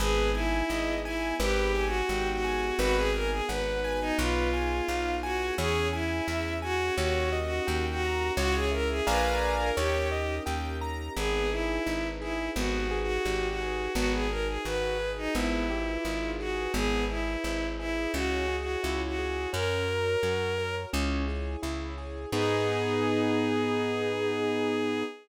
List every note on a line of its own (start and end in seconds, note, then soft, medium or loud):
0.00 0.63 G#1 loud
0.00 1.37 B3 medium
0.00 1.37 D#4 medium
0.00 0.30 G#4 loud
0.00 1.37 G#4 medium
0.00 0.31 B4 medium
0.34 0.94 E4 loud
0.34 0.66 G#5 medium
0.69 1.33 G#1 medium
0.69 1.01 D#5 medium
1.05 1.35 E4 loud
1.05 1.37 G#5 medium
1.39 2.02 G#1 loud
1.39 2.77 B3 medium
1.39 2.77 D#4 medium
1.39 2.77 G4 medium
1.39 1.85 G4 loud
1.39 2.77 G#4 medium
1.39 1.71 B4 medium
1.75 2.06 G#5 medium
1.86 2.30 F#4 loud
2.09 2.72 G#1 medium
2.09 2.41 G5 medium
2.33 2.78 F#4 loud
2.44 2.76 G#5 medium
2.79 3.41 G#1 loud
2.79 4.17 B3 medium
2.79 4.17 D#4 medium
2.79 4.17 F#4 medium
2.79 2.96 F#4 loud
2.79 4.17 G#4 medium
2.79 3.11 B4 loud
2.97 3.13 G#4 loud
3.14 3.30 A#4 loud
3.14 3.45 G#5 medium
3.31 3.48 G#4 medium
3.49 4.12 G#1 medium
3.49 4.00 B4 medium
3.49 3.80 F#5 medium
3.84 4.16 G#5 medium
4.01 4.18 D#4 loud
4.18 4.81 B1 loud
4.18 5.57 B3 medium
4.18 5.57 D#4 medium
4.18 5.15 F4 medium
4.18 5.57 F4 medium
4.18 5.57 G#4 medium
4.18 4.50 B4 medium
4.53 4.85 G#5 medium
4.88 5.51 B1 medium
4.88 5.20 F5 medium
5.23 5.54 F#4 loud
5.23 5.55 G#5 medium
5.58 6.21 E2 loud
5.58 6.97 C#4 medium
5.58 6.97 E4 medium
5.58 5.88 G#4 loud
5.58 6.97 G#4 medium
5.58 5.90 C#5 medium
5.93 6.53 E4 medium
5.93 6.25 G#5 medium
6.27 6.91 E2 medium
6.27 6.59 E5 medium
6.62 6.95 F#4 loud
6.62 6.94 G#5 medium
6.98 7.60 D#2 loud
6.98 8.36 C#4 medium
6.98 8.36 D#4 medium
6.98 7.38 F#4 loud
6.98 8.36 G4 medium
6.98 8.36 A#4 medium
6.98 7.29 C#5 medium
7.32 7.64 D#5 medium
7.44 7.85 F#4 medium
7.67 8.31 D#2 medium
7.67 7.99 G5 medium
7.91 8.33 F#4 loud
8.02 8.34 A#5 medium
8.37 9.01 C#2 loud
8.37 9.07 C#4 medium
8.37 9.07 E4 medium
8.37 8.54 F#4 loud
8.37 9.07 G#4 medium
8.37 8.69 C#5 loud
8.55 8.71 G#4 loud
8.72 8.89 A#4 loud
8.72 9.03 E5 medium
8.90 9.06 G#4 loud
9.07 9.71 A#1 loud
9.07 9.76 D4 medium
9.07 9.76 F4 medium
9.07 9.76 G#4 medium
9.07 9.76 A#4 medium
9.07 9.53 B4 medium
9.07 9.70 D5 medium
9.07 9.70 F5 medium
9.07 9.70 G#5 medium
9.07 9.70 A#5 medium
9.59 9.76 A#4 loud
9.77 10.40 D#2 loud
9.77 11.15 C#4 medium
9.77 11.15 D#4 medium
9.77 10.34 G4 medium
9.77 11.15 G4 medium
9.77 11.15 A#4 medium
9.77 10.08 C#5 loud
10.12 10.43 D#5 medium
10.46 11.09 D#2 medium
10.46 10.77 G5 medium
10.81 11.13 A#5 medium
11.16 11.79 G#1 loud
11.16 11.48 B3 medium
11.16 12.55 D#4 medium
11.16 11.50 G#4 loud
11.16 12.55 G#4 medium
11.16 12.55 B4 medium
11.51 12.07 E4 medium
11.51 11.83 G#4 medium
11.86 12.49 G#1 medium
11.86 12.18 D#4 medium
12.21 12.50 E4 medium
12.21 12.53 G#4 medium
12.55 13.19 G#1 loud
12.55 12.87 B3 medium
12.55 13.93 D#4 medium
12.55 12.99 F#4 medium
12.55 13.93 G4 medium
12.55 13.93 G#4 medium
12.55 13.93 B4 medium
12.91 13.22 G#4 medium
13.02 13.48 F#4 loud
13.25 13.88 G#1 medium
13.25 13.57 G4 medium
13.49 13.93 F#4 medium
13.61 13.92 G#4 medium
13.95 14.58 G#1 loud
13.95 14.27 B3 medium
13.95 15.34 D#4 medium
13.95 14.12 F#4 loud
13.95 15.34 F#4 medium
13.95 15.34 G#4 medium
13.95 15.34 B4 medium
14.13 14.29 G#4 medium
14.30 14.62 G#4 medium
14.30 14.47 A#4 loud
14.48 14.64 G#4 medium
14.65 15.28 G#1 medium
14.65 14.97 F#4 medium
14.65 15.11 B4 loud
15.00 15.31 G#4 medium
15.17 15.34 D#4 loud
15.35 15.98 G#1 loud
15.35 15.67 B3 medium
15.35 16.73 D#4 medium
15.35 16.30 E4 medium
15.35 16.73 F4 medium
15.35 16.73 G#4 medium
15.35 16.73 B4 medium
15.70 16.02 G4 medium
16.05 16.68 G#1 medium
16.05 16.37 F4 medium
16.39 16.72 F#4 medium
16.39 16.71 G#4 medium
16.74 17.37 G#1 loud
16.74 17.06 B3 medium
16.74 18.13 E4 medium
16.74 17.04 G#4 loud
16.74 18.13 G#4 medium
16.74 18.13 B4 medium
17.09 17.66 E4 medium
17.09 17.41 G#4 medium
17.44 18.07 G#1 medium
17.44 17.75 E4 medium
17.79 18.12 E4 loud
17.79 18.11 G#4 medium
18.13 18.77 C#2 loud
18.13 18.46 C#4 medium
18.13 19.51 E4 medium
18.13 18.56 F#4 loud
18.13 19.51 G#4 medium
18.13 19.51 C#5 medium
18.48 18.80 G#4 medium
18.61 19.01 F#4 medium
18.83 19.47 C#2 medium
18.83 19.15 E4 medium
19.07 19.49 F#4 medium
19.19 19.50 G#4 medium
19.53 20.16 F#2 loud
19.53 19.84 C#4 medium
19.53 20.92 F#4 medium
19.53 20.75 A#4 loud
19.53 20.92 A#4 medium
19.53 20.92 C#5 medium
19.88 20.19 A#4 medium
20.23 20.86 F#2 medium
20.23 20.55 F#4 medium
20.58 20.90 A#4 medium
20.93 21.56 C#2 loud
20.93 21.24 C#4 medium
20.93 22.31 E4 medium
20.93 22.31 G#4 medium
20.93 22.31 C#5 medium
21.28 21.59 G#4 medium
21.62 22.26 C#2 medium
21.62 21.94 E4 medium
21.98 22.29 G#4 medium
22.32 25.03 G#2 loud
22.32 25.03 B3 medium
22.32 25.03 B3 loud
22.32 25.03 D#4 medium
22.32 25.03 D#4 loud
22.32 25.03 G#4 loud
22.32 25.03 G#4 medium